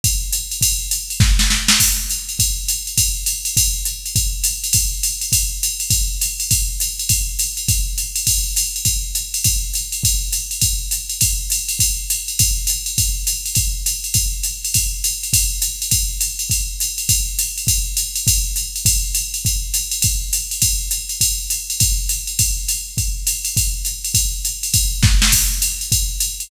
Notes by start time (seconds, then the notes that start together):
0.04 kick, ride
0.33 hi-hat pedal, ride
0.51 ride
0.61 kick, ride
0.91 hi-hat pedal, ride
1.10 ride
1.20 kick, snare
1.39 snare
1.50 snare
1.68 snare
1.80 kick, crash, ride
2.09 hi-hat pedal, ride
2.29 ride
2.39 kick, ride
2.68 hi-hat pedal, ride
2.87 ride
2.98 kick, ride
3.26 hi-hat pedal, ride
3.45 ride
3.57 kick, ride
3.85 hi-hat pedal, ride
4.06 ride
4.16 kick, ride
4.44 hi-hat pedal, ride
4.64 ride
4.73 kick, ride
5.03 hi-hat pedal, ride
5.21 ride
5.32 kick, ride
5.63 hi-hat pedal, ride
5.80 ride
5.90 kick, ride
6.21 hi-hat pedal, ride
6.40 ride
6.51 kick, ride
6.80 hi-hat pedal, ride
6.99 ride
7.09 kick, ride
7.39 hi-hat pedal, ride
7.57 ride
7.68 kick, ride
7.98 hi-hat pedal, ride
8.16 ride
8.27 kick, ride
8.56 hi-hat pedal, ride
8.76 ride
8.85 kick, ride
9.15 hi-hat pedal, ride
9.34 ride
9.44 kick, ride
9.74 hi-hat pedal, ride
9.92 ride
10.03 kick, ride
10.32 hi-hat pedal, ride
10.51 ride
10.61 kick, ride
10.91 hi-hat pedal, ride
11.09 ride
11.21 kick, ride
11.50 hi-hat pedal, ride
11.69 ride
11.79 kick, ride
12.10 hi-hat pedal, ride
12.28 ride
12.39 kick, ride
12.67 hi-hat pedal, ride
12.86 ride
12.98 kick, ride
13.27 hi-hat pedal, ride
13.46 ride
13.55 kick, ride
13.86 hi-hat pedal, ride
14.04 ride
14.14 kick, ride
14.43 hi-hat pedal, ride
14.65 ride
14.74 kick, ride
15.04 hi-hat pedal, ride
15.23 ride
15.33 kick, ride
15.62 hi-hat pedal, ride
15.82 ride
15.91 kick, ride
16.21 hi-hat pedal, ride
16.39 ride
16.50 kick, ride
16.80 hi-hat pedal, ride
16.98 ride
17.09 kick, ride
17.39 hi-hat pedal, ride
17.58 ride
17.67 kick, ride
17.97 hi-hat pedal, ride
18.16 ride
18.27 kick, ride
18.56 hi-hat pedal, ride
18.76 ride
18.85 kick, ride
19.15 hi-hat pedal, ride
19.34 ride
19.45 kick, ride
19.74 hi-hat pedal, ride
19.91 ride
20.02 kick, ride
20.33 hi-hat pedal, ride
20.51 ride
20.62 kick, ride
20.91 hi-hat pedal, ride
21.09 ride
21.21 kick, ride
21.50 hi-hat pedal, ride
21.70 ride
21.80 kick, ride
22.09 hi-hat pedal, ride
22.27 ride
22.39 kick, ride
22.68 hi-hat pedal, ride
22.97 kick, ride
23.27 hi-hat pedal, ride
23.45 ride
23.57 kick, ride
23.85 hi-hat pedal, ride
24.04 ride
24.14 kick, ride
24.45 hi-hat pedal, ride
24.63 ride
24.74 kick, ride
25.03 kick, snare
25.22 snare
25.32 kick, crash, ride
25.62 hi-hat pedal, ride
25.81 ride
25.92 kick, ride
26.20 hi-hat pedal, ride
26.40 ride